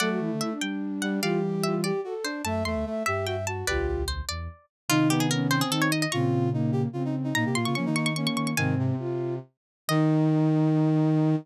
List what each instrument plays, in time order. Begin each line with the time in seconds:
0.00 flute F#3 A4, brass section A3, harpsichord D5 F#5
0.10 flute F#4
0.19 flute E3 E4
0.32 flute D3
0.40 flute E4, harpsichord E5
0.51 flute D4
0.61 flute G3, harpsichord G5
1.02 brass section G3, harpsichord F#5
1.22 flute E3 G3 F4, brass section G4, harpsichord D5 F5
1.43 flute G4
1.64 flute F4, harpsichord E5
1.83 flute G4, brass section G4, harpsichord D5
2.04 brass section F#4, flute A4
2.24 brass section D4, harpsichord C5
2.44 flute F#2 E5, brass section A3, harpsichord A5
2.65 flute E2 E5, brass section A3, harpsichord C6
2.75 flute D2
2.86 brass section A3, flute E5
3.06 flute G2 E5, brass section G4, harpsichord E5
3.26 brass section F#4, flute E5, harpsichord G5
3.47 brass section F#4, harpsichord A5
3.67 flute B1 D2 F4, brass section G4, harpsichord B4 D5
3.87 brass section G4
4.08 harpsichord C5
4.29 flute E2, harpsichord D5
4.89 flute C3 D#3 D#4, brass section D#4, harpsichord F4
5.10 brass section B3, harpsichord G4
5.20 harpsichord G#4
5.31 flute C#4, harpsichord A#4
5.51 brass section C4, harpsichord C5
5.61 harpsichord G#4
5.70 flute D#3 D#4, harpsichord A4
5.82 harpsichord C#5
5.92 harpsichord D#5
6.02 harpsichord D#5
6.12 flute A#2 C#3 C4, brass section F4, harpsichord A#5 C#6
6.53 flute A#3, brass section D#4
6.72 brass section G4
6.93 flute C#3 C4, brass section F4
7.05 brass section D#4
7.24 brass section D#4
7.35 flute A#2 A#3, brass section D#4, harpsichord A#5
7.45 flute C3, brass section G4
7.55 flute A#2, brass section F4, harpsichord C6
7.65 flute C#3, brass section F4, harpsichord C#6
7.75 flute F3 A#3, brass section C#4, harpsichord C#6
7.86 flute D#3, brass section D#4
7.96 brass section D#4, harpsichord C#6
8.06 harpsichord C#6
8.15 flute A#3, brass section C#4, harpsichord C#6
8.27 harpsichord C#6
8.36 flute D#3, harpsichord C#6
8.47 harpsichord C#6
8.57 flute G#2 C3 C4, brass section D#3, harpsichord F5 G#5
8.79 brass section C3
8.99 flute F4
9.88 flute D#3 D#4, brass section D#3, harpsichord D#5